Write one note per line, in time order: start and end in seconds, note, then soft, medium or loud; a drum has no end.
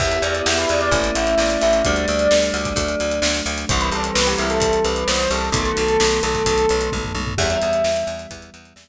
0.00 0.19 E2 loud
0.00 0.90 B3 loud
0.00 0.90 E4 medium
0.00 0.90 G4 medium
0.00 0.11 E5 medium
0.00 kick medium
0.00 crash medium
0.11 0.22 E5 medium
0.11 closed hi-hat medium
0.22 0.42 E2 loud
0.22 0.44 D5 medium
0.22 closed hi-hat medium
0.35 closed hi-hat medium
0.46 0.66 E2 medium
0.46 0.57 E5 medium
0.46 snare loud
0.58 0.69 B4 medium
0.58 closed hi-hat medium
0.69 0.90 E2 medium
0.69 0.81 D5 medium
0.69 closed hi-hat medium
0.81 1.13 D5 medium
0.81 closed hi-hat medium
0.91 1.11 A1 loud
0.91 1.83 A3 loud
0.91 1.83 C#4 medium
0.91 1.83 E4 loud
0.91 kick medium
0.91 closed hi-hat medium
1.04 closed hi-hat medium
1.15 1.35 A1 medium
1.15 1.35 E5 medium
1.15 closed hi-hat medium
1.27 closed hi-hat medium
1.38 1.57 A1 medium
1.38 1.61 D5 medium
1.38 snare medium
1.50 closed hi-hat medium
1.62 1.82 A1 medium
1.62 1.72 E5 medium
1.62 closed hi-hat medium
1.73 closed hi-hat medium
1.85 2.06 D2 loud
1.85 2.76 G3 medium
1.85 2.76 A3 medium
1.85 2.76 D4 medium
1.85 2.43 D5 medium
1.85 kick medium
1.85 closed hi-hat medium
1.96 closed hi-hat medium
2.08 2.28 D2 loud
2.08 closed hi-hat medium
2.19 closed hi-hat medium
2.31 2.51 D2 medium
2.31 snare loud
2.42 closed hi-hat medium
2.54 2.73 D2 medium
2.54 3.16 D5 medium
2.54 closed hi-hat medium
2.65 kick medium
2.65 closed hi-hat medium
2.76 2.95 D2 loud
2.76 3.67 F#3 medium
2.76 3.67 A3 loud
2.76 3.67 D4 medium
2.76 kick medium
2.76 closed hi-hat medium
2.88 closed hi-hat medium
3.00 3.20 D2 medium
3.00 closed hi-hat medium
3.11 closed hi-hat medium
3.22 3.42 D2 loud
3.22 snare loud
3.35 closed hi-hat medium
3.46 3.65 D2 loud
3.46 closed hi-hat medium
3.58 closed hi-hat medium
3.69 3.90 C2 loud
3.69 5.50 E3 medium
3.69 5.50 G3 loud
3.69 5.50 C4 medium
3.69 3.80 C5 medium
3.69 kick loud
3.69 closed hi-hat loud
3.81 3.92 B4 medium
3.81 closed hi-hat medium
3.91 4.11 C2 medium
3.91 4.12 A4 medium
3.91 closed hi-hat medium
4.04 closed hi-hat medium
4.15 4.35 C2 loud
4.15 4.26 B4 medium
4.15 snare loud
4.27 4.38 G4 medium
4.27 closed hi-hat medium
4.38 4.59 C2 medium
4.38 4.50 E4 medium
4.38 closed hi-hat medium
4.50 4.80 A4 medium
4.50 closed hi-hat medium
4.60 4.80 C2 medium
4.60 kick medium
4.60 closed hi-hat loud
4.73 closed hi-hat medium
4.84 5.04 C2 medium
4.84 5.03 B4 medium
4.84 closed hi-hat medium
4.96 closed hi-hat medium
5.08 5.27 C2 medium
5.08 5.29 C5 medium
5.08 snare loud
5.19 closed hi-hat medium
5.30 5.50 C2 medium
5.30 5.42 A4 medium
5.30 closed hi-hat medium
5.52 5.72 B1 loud
5.52 7.35 D#3 medium
5.52 7.35 F#3 loud
5.52 7.35 A3 loud
5.52 7.35 B3 medium
5.52 6.13 A4 medium
5.52 kick loud
5.52 closed hi-hat loud
5.65 closed hi-hat medium
5.77 5.97 B1 medium
5.77 closed hi-hat medium
5.88 closed hi-hat medium
6.00 6.20 B1 loud
6.00 snare loud
6.12 closed hi-hat medium
6.23 6.43 B1 medium
6.23 6.89 A4 medium
6.23 closed hi-hat medium
6.35 kick medium
6.35 closed hi-hat medium
6.46 6.66 B1 loud
6.46 kick medium
6.46 closed hi-hat loud
6.58 closed hi-hat medium
6.69 6.90 B1 medium
6.69 closed hi-hat medium
6.81 closed hi-hat medium
6.92 7.12 B1 medium
6.92 kick medium
6.92 high tom medium
7.04 floor tom medium
7.15 7.34 B1 medium
7.15 high tom medium
7.27 floor tom loud
7.38 7.58 E2 loud
7.38 8.89 E3 medium
7.38 8.89 G3 medium
7.38 8.89 B3 medium
7.38 8.14 E5 medium
7.38 kick medium
7.38 crash loud
7.50 closed hi-hat medium
7.62 7.82 E2 medium
7.62 closed hi-hat medium
7.73 closed hi-hat medium
7.84 8.04 E2 medium
7.84 snare loud
7.96 closed hi-hat medium
8.07 8.27 E2 loud
8.07 closed hi-hat medium
8.19 closed hi-hat medium
8.31 8.50 E2 medium
8.31 kick medium
8.31 closed hi-hat medium
8.42 closed hi-hat medium
8.54 8.73 E2 medium
8.54 closed hi-hat medium
8.65 closed hi-hat medium
8.76 8.89 E2 medium
8.76 snare loud